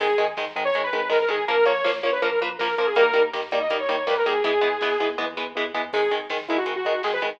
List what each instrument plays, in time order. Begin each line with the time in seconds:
0.00 synth bass 1 G#1, overdriven guitar D#3 G#3, lead 2 (sawtooth) G#4, kick, crash
0.09 kick
0.18 synth bass 1 G#1, overdriven guitar D#3 G#3, kick, closed hi-hat
0.28 kick
0.37 synth bass 1 G#1, overdriven guitar D#3 G#3, kick, snare
0.47 kick
0.56 synth bass 1 G#1, overdriven guitar D#3 G#3, kick, closed hi-hat
0.65 lead 2 (sawtooth) C#5, kick
0.74 synth bass 1 G#1, overdriven guitar D#3 G#3, kick, closed hi-hat
0.83 lead 2 (sawtooth) B4, kick
0.93 synth bass 1 G#1, overdriven guitar D#3 G#3, kick, closed hi-hat
1.01 kick
1.09 synth bass 1 G#1, overdriven guitar D#3 G#3, lead 2 (sawtooth) A#4, kick, snare
1.20 lead 2 (sawtooth) A#4, kick
1.28 synth bass 1 G#1, overdriven guitar D#3 G#3, lead 2 (sawtooth) G#4, kick, closed hi-hat
1.39 kick
1.48 synth bass 1 A#1, overdriven guitar F3 A#3, lead 2 (sawtooth) A#4, kick, closed hi-hat
1.58 kick
1.65 synth bass 1 A#1, overdriven guitar F3 A#3, lead 2 (sawtooth) C#5, kick, closed hi-hat
1.76 kick
1.84 synth bass 1 A#1, overdriven guitar F3 A#3, kick, snare
1.94 kick
2.03 synth bass 1 A#1, overdriven guitar F3 A#3, lead 2 (sawtooth) C#5, kick, closed hi-hat
2.12 lead 2 (sawtooth) B4, kick
2.22 synth bass 1 A#1, overdriven guitar F3 A#3, lead 2 (sawtooth) A#4, kick, closed hi-hat
2.31 lead 2 (sawtooth) A#4, kick
2.40 synth bass 1 A#1, overdriven guitar F3 A#3, lead 2 (sawtooth) B4, kick, closed hi-hat
2.51 kick
2.59 synth bass 1 A#1, overdriven guitar F3 A#3, lead 2 (sawtooth) A#4, kick, snare
2.69 kick
2.78 synth bass 1 A#1, overdriven guitar F3 A#3, lead 2 (sawtooth) A#4, kick, closed hi-hat
2.86 lead 2 (sawtooth) G#4, kick
2.95 synth bass 1 D#2, overdriven guitar D#3 G3 A#3, lead 2 (sawtooth) A#4, kick, closed hi-hat
3.05 kick
3.14 synth bass 1 D#2, overdriven guitar D#3 G3 A#3, kick, closed hi-hat
3.24 kick
3.33 synth bass 1 D#2, overdriven guitar D#3 G3 A#3, kick, snare
3.42 kick
3.51 synth bass 1 D#2, overdriven guitar D#3 G3 A#3, kick, closed hi-hat
3.61 lead 2 (sawtooth) D#5, kick
3.69 synth bass 1 D#2, overdriven guitar D#3 G3 A#3, kick, closed hi-hat
3.80 lead 2 (sawtooth) C#5, kick
3.88 synth bass 1 D#2, overdriven guitar D#3 G3 A#3, kick, closed hi-hat
3.99 kick
4.07 synth bass 1 D#2, overdriven guitar D#3 G3 A#3, lead 2 (sawtooth) B4, kick, snare
4.17 lead 2 (sawtooth) A#4, kick
4.25 synth bass 1 D#2, overdriven guitar D#3 G3 A#3, lead 2 (sawtooth) G#4, kick, closed hi-hat
4.35 kick
4.44 synth bass 1 E2, overdriven guitar E3 G#3 B3, lead 2 (sawtooth) G#4, kick, closed hi-hat
4.54 kick
4.61 synth bass 1 E2, overdriven guitar E3 G#3 B3, kick, closed hi-hat
4.73 kick
4.81 synth bass 1 E2, overdriven guitar E3 G#3 B3, kick, snare
4.91 kick
4.99 synth bass 1 E2, overdriven guitar E3 G#3 B3, kick, closed hi-hat
5.10 kick
5.18 synth bass 1 E2, overdriven guitar E3 G#3 B3, kick, high tom
5.37 synth bass 1 E2, overdriven guitar E3 G#3 B3, floor tom
5.55 synth bass 1 E2, overdriven guitar E3 G#3 B3
5.74 synth bass 1 E2, overdriven guitar E3 G#3 B3, floor tom
5.93 synth bass 1 G#1, overdriven guitar D#3 G#3, lead 2 (sawtooth) G#4, kick, crash
6.03 kick
6.11 synth bass 1 G#1, overdriven guitar D#3 G#3, kick, closed hi-hat
6.19 kick
6.30 synth bass 1 G#1, overdriven guitar D#3 G#3, kick, snare
6.39 kick
6.47 synth bass 1 G#1, overdriven guitar D#3 G#3, lead 2 (sawtooth) E4, kick, closed hi-hat
6.58 lead 2 (sawtooth) F#4, kick
6.66 synth bass 1 G#1, overdriven guitar D#3 G#3, kick, closed hi-hat
6.76 lead 2 (sawtooth) F#4, kick
6.85 synth bass 1 G#1, overdriven guitar D#3 G#3, kick, closed hi-hat
6.93 kick
7.03 synth bass 1 G#1, overdriven guitar D#3 G#3, lead 2 (sawtooth) G#4, kick, snare
7.12 lead 2 (sawtooth) B4, kick
7.22 synth bass 1 G#1, overdriven guitar D#3 G#3, kick, closed hi-hat
7.32 kick